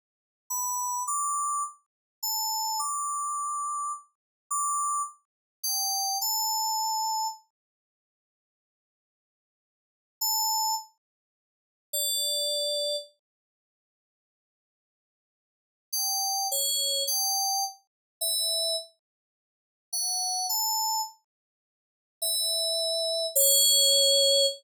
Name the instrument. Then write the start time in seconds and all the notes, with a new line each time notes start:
electric piano 2
0.50 B5
1.07 D6
2.23 A5
2.79 D6
4.51 D6
5.63 G5
6.21 A5
10.21 A5
11.93 D5
15.93 G5
16.51 C#5
17.07 G5
18.21 E5
19.93 F#5
20.49 A5
22.22 E5
23.35 C#5